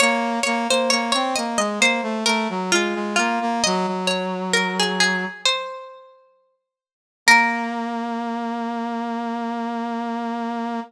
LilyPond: <<
  \new Staff \with { instrumentName = "Pizzicato Strings" } { \time 4/4 \key bes \minor \tempo 4 = 66 des''8 des''16 c''16 des''16 des''16 ees''16 ees''16 c''8 bes'8 f'8 f'8 | ees''8 des''8 bes'16 aes'16 aes'8 c''4. r8 | bes'1 | }
  \new Staff \with { instrumentName = "Brass Section" } { \time 4/4 \key bes \minor bes8 bes16 bes16 bes16 c'16 bes16 aes16 bes16 a16 a16 ges16 aes16 aes16 bes16 bes16 | ges16 ges4.~ ges16 r2 | bes1 | }
>>